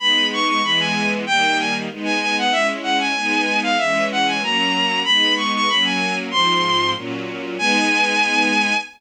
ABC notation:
X:1
M:2/4
L:1/16
Q:1/4=95
K:G#m
V:1 name="Violin"
b2 c' c' b g2 z | =g2 ^g z2 g g f | e z f g4 =f | e2 f g a4 |
b2 c' c' b g2 z | ^b4 z4 | g8 |]
V:2 name="String Ensemble 1"
[G,B,D]4 [E,G,B,]4 | [D,=G,A,]4 [^G,B,D]4 | [G,CE]4 [G,B,D]4 | [E,G,C]4 [F,A,C]4 |
[G,B,D]4 [F,A,C]4 | [G,,^E,^B,]4 [A,,F,C]4 | [G,B,D]8 |]